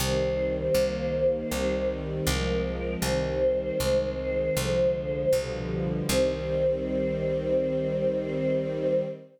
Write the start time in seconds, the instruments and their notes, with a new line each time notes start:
0.00 electric bass (finger) C2, string ensemble 1 D#3 G3 C4, choir aahs C5
0.75 electric bass (finger) C2, string ensemble 1 D#3 G3 A#3
1.51 electric bass (finger) C2, string ensemble 1 D#3 G3 C4
2.27 electric bass (finger) C2, string ensemble 1 F3 G#3 C4, choir aahs A#4
3.02 electric bass (finger) C2, string ensemble 1 D#3 G3 C4, choir aahs C5
3.79 electric bass (finger) C2, string ensemble 1 D#3 G#3 C4
4.55 electric bass (finger) C2, string ensemble 1 D3 F3 G#3
5.32 electric bass (finger) C2, string ensemble 1 B2 D3 F3 G3
6.08 electric bass (finger) C2, string ensemble 1 D#3 G3 C4, choir aahs C5